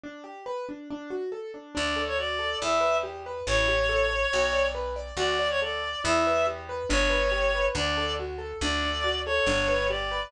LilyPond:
<<
  \new Staff \with { instrumentName = "Clarinet" } { \time 4/4 \key d \major \tempo 4 = 140 r1 | d''8. cis''16 d''4 e''4 r4 | cis''2. r4 | d''8. cis''16 d''4 e''4 r4 |
cis''2 d''4 r4 | d''4. cis''4. d''4 | }
  \new Staff \with { instrumentName = "Acoustic Grand Piano" } { \time 4/4 \key d \major d'8 g'8 b'8 d'8 d'8 fis'8 a'8 d'8 | d'8 a'8 fis'8 a'8 e'8 b'8 g'8 b'8 | e'8 g'8 a'8 cis''8 fis'8 d''8 b'8 d''8 | fis'8 d''8 a'8 d''8 e'8 b'8 g'8 b'8 |
d'8 b'8 g'8 b'8 d'8 a'8 fis'8 a'8 | d'8 a'8 fis'8 a'8 d'8 b'8 g'8 b'8 | }
  \new Staff \with { instrumentName = "Electric Bass (finger)" } { \clef bass \time 4/4 \key d \major r1 | d,2 e,2 | a,,2 b,,2 | d,2 e,2 |
g,,2 d,2 | d,2 g,,2 | }
>>